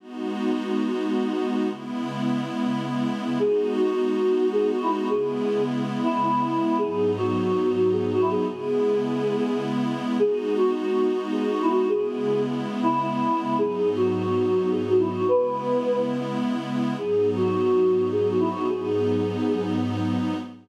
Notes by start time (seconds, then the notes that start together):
0.00 G#3 B3 D#4 F#4
1.70 C#3 G#3 B3 E4
3.39 G#3 B3 D#4 F#4 G#4
3.76 F#4
4.53 G#4
4.72 F#4
4.82 E4
4.91 F#4
5.08 C#3 G#3 B3 E4 G#4
6.03 E4
6.23 E4
6.78 G#2 F#3 B3 D#4 G#4
7.18 F#4
7.92 G#4
8.12 F#4
8.21 E4
8.31 G#4
8.48 C#3 G#3 B3 E4 G#4
10.18 G#3 B3 D#4 F#4 G#4
10.57 F#4
11.32 G#4
11.51 F#4
11.62 E4
11.71 F#4
11.88 C#3 G#3 B3 E4 G#4
12.83 E4
13.01 E4
13.58 G#2 F#3 B3 D#4 G#4
13.96 F#4
14.71 G#4
14.89 F#4
14.99 E4
15.10 F#4
15.27 C#3 G#3 B3 E4 B4
16.98 G#2 F#3 B3 D#4 G#4
17.36 F#4
18.12 G#4
18.29 F#4
18.40 E4
18.49 F#4
18.68 G#2 F#3 B3 D#4 G#4